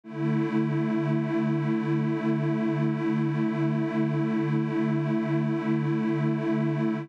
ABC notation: X:1
M:4/4
L:1/8
Q:1/4=68
K:A
V:1 name="Pad 2 (warm)"
[D,A,E]8- | [D,A,E]8 |]